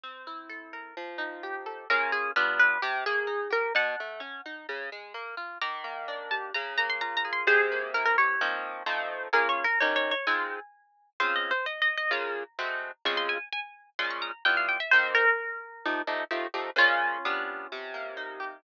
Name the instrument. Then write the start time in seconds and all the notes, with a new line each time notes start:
orchestral harp
0.03 C4
0.27 E4
0.49 A4
0.73 A#4
0.97 F3
1.18 D#4
1.43 G4
1.66 A4
1.90 A#3 C#4 F4 G#4 A#4
2.12 G#4
2.36 G3 B3 D4 F4 B4
2.59 B4
2.82 C3 G4
3.06 A#3 G#4
3.27 D#4
3.50 G4 A#4
3.75 B2 F#5 A5
4.00 A3
4.20 C#4
4.46 D#4
4.69 C#3
4.92 G#3
5.14 A#3
5.37 F4
5.61 D#3 A#5 D6
5.84 A#3
6.08 D4
6.31 G4 A5
6.54 C#3 A#5
6.78 A#3 A#5
6.90 C6
7.01 F4 A#5
7.17 A#5
7.25 G#4
7.33 C6
7.47 C3 G#4 C5
7.72 A#3
7.94 E4 A#4
8.06 A#4
8.18 G4 C#5
8.41 F3 A#3 C4 D#4
8.86 F3 A3 C4 D#4
9.33 A#3 C#4 F4 G#4 A#4
9.49 C#5
9.64 A#4
9.80 D#3 C#4 G4 A#4 C#5
9.96 C#5
10.11 C#5
10.27 G#3 C4 D#4 F4 G#5
11.20 C#3 C4 F4 G#4 C5
11.36 D#5
11.51 C5
11.66 D#5
11.82 D#5
11.97 D#5
12.11 C#3 A#3 F4 G#4 A#5
12.59 G#3 A3 C4 F#4
13.05 C#3 G#3 C4 F4 C#6
13.17 C6
13.29 G#5
13.53 G#5
13.99 A#2 G#3 C#4 F4 C6
14.10 C#6
14.22 A#5
14.45 G3 B3 E4 F4 G5
14.57 F5
14.69 G5
14.80 E5
14.91 D#3 A#3 C4 G4 C5
15.15 A#4
15.86 F3 A3 D#4 G4
16.07 F3 A3 D#4 G4
16.31 F3 A3 D#4 G4
16.54 F3 A3 D#4 G4
16.76 A#2 C#3 G#3 C#4 F4
17.25 G3 B3 D4 F4
17.72 C3
17.94 A#3
18.17 D#4
18.40 G4